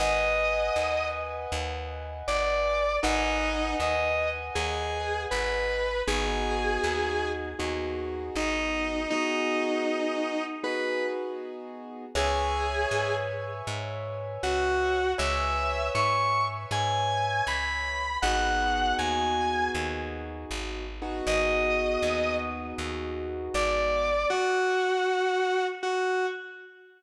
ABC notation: X:1
M:4/4
L:1/8
Q:"Swing" 1/4=79
K:G#m
V:1 name="Distortion Guitar"
d3 z3 =d2 | D2 d z G2 B2 | G3 z3 D2 | D4 B z3 |
G3 z3 F2 | e2 c' z g2 b2 | f2 g2 z4 | d3 z3 =d2 |
F4 F z3 |]
V:2 name="Acoustic Grand Piano"
[Bdfg]8 | [Bdfg]8 | [B,DFG]4 [B,DFG]4 | [B,DFG]4 [B,DFG]4 |
[Bceg]8 | [Bceg]8 | [B,DFG]7 [B,DFG]- | [B,DFG]8 |
z8 |]
V:3 name="Electric Bass (finger)" clef=bass
G,,,2 D,,2 D,,2 G,,,2 | G,,,2 D,,2 D,,2 G,,,2 | G,,,2 D,,2 D,,2 G,,,2 | z8 |
C,,2 G,,2 G,,2 C,,2 | C,,2 G,,2 G,,2 C,,2 | G,,,2 D,,2 D,,2 G,,,2 | G,,,2 D,,2 D,,2 G,,,2 |
z8 |]